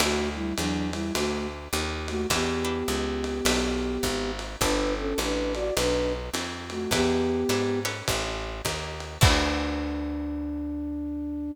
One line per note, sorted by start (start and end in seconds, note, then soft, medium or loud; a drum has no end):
0.00 0.53 D2 medium
0.00 0.29 A3 medium
0.00 0.43 D4 medium
0.00 0.43 E4 medium
0.00 0.29 F#4 medium
0.00 0.43 F#4 medium
0.00 0.43 A4 medium
0.00 ride loud
0.35 0.55 G3 medium
0.35 0.55 E4 medium
0.58 1.11 E2 medium
0.58 0.90 F#3 medium
0.58 0.90 D4 medium
0.58 hi-hat pedal medium
0.58 ride medium
0.92 1.13 G3 medium
0.92 1.13 E4 medium
0.92 ride medium
1.14 1.68 D2 medium
1.14 1.47 A3 medium
1.14 1.47 F#4 medium
1.14 ride medium
1.73 2.26 D#2 medium
1.73 hi-hat pedal medium
1.73 ride medium
2.08 2.27 A3 medium
2.08 2.27 F#4 medium
2.08 ride medium
2.30 2.83 E2 medium
2.30 4.31 B3 medium
2.30 2.55 D4 medium
2.30 2.55 E4 medium
2.30 2.55 G4 medium
2.30 4.31 G4 medium
2.30 2.55 B4 medium
2.30 kick soft
2.30 ride medium
2.65 3.01 D4 medium
2.65 3.01 E4 medium
2.65 3.01 G4 medium
2.65 3.01 B4 medium
2.88 3.41 C#2 medium
2.88 hi-hat pedal medium
2.88 ride medium
3.24 ride medium
3.45 3.98 B1 medium
3.45 3.91 D4 medium
3.45 3.91 E4 medium
3.45 3.91 G4 medium
3.45 3.91 B4 medium
3.45 ride loud
4.03 4.56 G#1 medium
4.03 kick soft
4.03 hi-hat pedal medium
4.03 ride medium
4.39 ride medium
4.61 5.14 G1 medium
4.61 5.06 D4 medium
4.61 4.94 D4 medium
4.61 5.06 G4 medium
4.61 5.06 A4 medium
4.61 5.06 B4 medium
4.61 4.94 B4 medium
4.61 kick medium
4.61 ride medium
4.98 5.19 C#4 medium
4.98 5.19 A4 medium
5.18 5.71 A1 medium
5.18 5.53 D4 medium
5.18 5.53 B4 medium
5.18 hi-hat pedal medium
5.18 ride medium
5.54 5.74 F#4 medium
5.54 5.74 D5 medium
5.54 ride medium
5.77 6.30 B1 medium
5.77 6.12 D4 medium
5.77 6.12 B4 medium
5.77 ride medium
6.34 6.87 F2 medium
6.34 hi-hat pedal medium
6.34 ride medium
6.70 6.91 A3 medium
6.70 6.91 F#4 medium
6.70 ride medium
6.91 7.44 E2 medium
6.91 7.80 B3 loud
6.91 7.37 D4 medium
6.91 7.37 E4 medium
6.91 7.80 G4 loud
6.91 7.37 G4 medium
6.91 7.37 B4 medium
6.91 kick medium
6.91 ride medium
7.49 8.02 G#2 medium
7.49 7.83 D4 medium
7.49 7.83 E4 medium
7.49 7.83 G4 medium
7.49 7.83 B4 medium
7.49 hi-hat pedal medium
7.49 ride medium
7.85 8.52 C#4 medium
7.85 8.52 G4 medium
7.85 8.52 A4 medium
7.85 8.52 B4 medium
7.85 ride medium
8.08 8.62 A1 medium
8.08 kick medium
8.08 ride medium
8.65 9.18 D#2 medium
8.65 kick soft
8.65 hi-hat pedal medium
8.65 ride medium
9.00 ride medium
9.21 11.51 D2 medium
9.21 11.50 D4 loud
9.21 11.51 D4 loud
9.21 11.50 E4 loud
9.21 11.50 F#4 loud
9.21 11.50 A4 loud
9.21 kick loud
9.21 crash loud